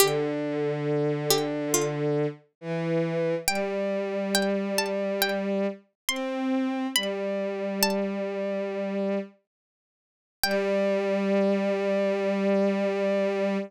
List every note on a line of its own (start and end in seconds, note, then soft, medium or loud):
0.00 2.26 D3 medium
0.00 1.10 G4 loud
1.30 1.69 G4 loud
1.74 3.42 F4 medium
2.61 3.35 E3 medium
3.48 5.67 G3 medium
3.48 4.28 G5 loud
4.35 4.73 G5 loud
4.78 5.20 A5 medium
5.22 5.95 G5 loud
6.09 6.87 C4 medium
6.09 6.80 C6 medium
6.96 9.18 G3 medium
6.96 7.81 B5 loud
7.83 9.37 A5 loud
10.43 13.57 G3 loud
10.43 13.57 G5 loud